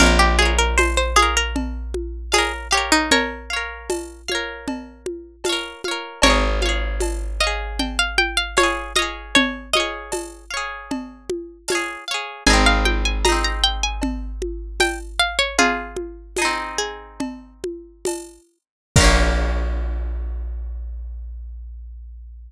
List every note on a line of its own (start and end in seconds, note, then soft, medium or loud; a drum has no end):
0.00 5.74 A#1 loud
0.00 0.19 A#4 medium
0.00 0.36 C#5 medium
0.00 0.36 F5 medium
0.00 cowbell medium
0.00 low conga medium
0.06 0.36 A#4 medium
0.19 0.38 G4 medium
0.39 0.57 G#4 medium
0.39 1.11 C#5 medium
0.39 1.11 F5 medium
0.39 high conga medium
0.45 1.11 A#4 medium
0.58 0.77 A#4 medium
0.78 0.96 C5 medium
0.78 tambourine medium
0.78 cowbell medium
0.78 high conga medium
0.97 1.16 C5 medium
1.16 1.35 G#4 medium
1.16 2.24 C#5 medium
1.16 2.24 F5 medium
1.16 high conga medium
1.22 2.24 A#4 medium
1.37 1.55 A#4 medium
1.56 cowbell medium
1.56 low conga medium
1.94 high conga medium
2.32 2.52 G#4 medium
2.32 2.68 C#5 medium
2.32 2.68 F5 medium
2.32 tambourine medium
2.32 cowbell medium
2.32 high conga medium
2.38 2.68 A#4 medium
2.71 2.91 G4 medium
2.71 3.43 C#5 medium
2.71 3.43 F5 medium
2.77 3.43 A#4 medium
2.92 3.10 D#4 medium
3.11 5.05 A#4 medium
3.11 5.05 C#5 loud
3.11 cowbell medium
3.11 low conga medium
3.50 4.22 C#5 medium
3.50 4.22 F5 medium
3.56 4.22 A#4 medium
3.90 tambourine medium
3.90 cowbell medium
3.90 high conga medium
4.28 5.36 C#5 medium
4.28 5.36 F5 medium
4.28 high conga medium
4.35 5.36 A#4 medium
4.68 cowbell medium
4.68 low conga medium
5.06 high conga medium
5.44 5.82 F5 medium
5.44 tambourine medium
5.44 cowbell medium
5.44 high conga medium
5.49 5.82 A#4 medium
5.49 5.82 C#5 medium
5.84 6.21 C#5 medium
5.84 6.21 F5 medium
5.84 high conga medium
5.91 6.21 A#4 medium
6.22 11.97 G#1 loud
6.22 6.91 A#4 medium
6.22 6.91 C#5 loud
6.22 6.59 F5 medium
6.22 cowbell loud
6.22 low conga medium
6.27 6.59 G#4 medium
6.27 6.59 C#5 medium
6.62 7.34 C#5 medium
6.62 7.34 F5 medium
6.62 high conga medium
6.69 7.34 G#4 medium
7.00 tambourine medium
7.00 cowbell medium
7.00 high conga medium
7.40 8.48 C#5 medium
7.40 7.79 D#5 medium
7.40 8.48 F5 medium
7.47 8.48 G#4 medium
7.79 7.98 G5 medium
7.79 cowbell medium
7.79 low conga medium
7.99 8.17 F5 medium
8.18 8.37 G5 medium
8.18 high conga medium
8.37 8.56 F5 medium
8.57 8.93 C#5 medium
8.57 8.93 F5 medium
8.57 tambourine medium
8.57 cowbell medium
8.57 high conga medium
8.63 8.93 G#4 medium
8.96 9.67 C#5 medium
8.96 9.34 D#5 medium
8.96 9.67 F5 medium
8.96 high conga medium
9.02 9.67 G#4 medium
9.35 9.70 C#5 loud
9.35 cowbell medium
9.35 low conga loud
9.73 10.45 C#5 medium
9.73 10.47 D#5 medium
9.73 10.45 F5 medium
9.73 high conga medium
9.80 10.45 G#4 medium
10.12 tambourine medium
10.12 cowbell medium
10.12 high conga medium
10.50 11.58 C#5 medium
10.50 11.58 F5 medium
10.57 11.58 G#4 medium
10.91 cowbell medium
10.91 low conga medium
11.30 high conga medium
11.68 12.04 C#5 medium
11.68 12.04 F5 medium
11.68 tambourine medium
11.68 cowbell medium
11.68 high conga medium
11.75 12.04 G#4 medium
12.08 12.44 C#5 medium
12.08 12.44 F5 medium
12.14 12.44 G#4 medium
12.47 18.39 G#1 loud
12.47 13.19 D#4 medium
12.47 13.19 G#4 medium
12.47 12.65 G#5 medium
12.47 cowbell medium
12.47 low conga medium
12.53 13.19 C4 medium
12.66 12.85 F5 medium
12.85 13.04 G5 medium
12.85 high conga medium
13.05 13.24 G#5 medium
13.25 16.13 G#4 medium
13.25 13.43 A#5 medium
13.25 tambourine medium
13.25 cowbell medium
13.25 high conga medium
13.29 16.13 C4 medium
13.29 16.13 D#4 medium
13.44 13.63 A#5 medium
13.64 13.82 G5 medium
13.83 14.02 G#5 medium
14.02 cowbell medium
14.02 low conga medium
14.42 high conga medium
14.80 14.99 G5 medium
14.80 tambourine medium
14.80 cowbell medium
14.80 high conga medium
15.19 15.38 F5 medium
15.39 15.57 C#5 medium
15.58 16.55 F4 medium
15.58 16.55 G#4 loud
15.58 cowbell medium
15.58 low conga medium
15.97 high conga medium
16.37 18.75 G#4 medium
16.37 tambourine medium
16.37 cowbell medium
16.37 high conga medium
16.42 18.75 C4 medium
16.42 18.75 D#4 medium
16.78 17.96 G#4 medium
17.20 cowbell medium
17.20 low conga medium
17.64 high conga medium
18.05 tambourine medium
18.05 cowbell medium
18.05 high conga medium
18.96 22.52 A#1 loud
18.96 22.52 F4 loud
18.96 22.52 A#4 loud
18.96 kick loud
18.96 crash loud
19.01 22.52 A#3 medium
19.01 22.52 C#4 loud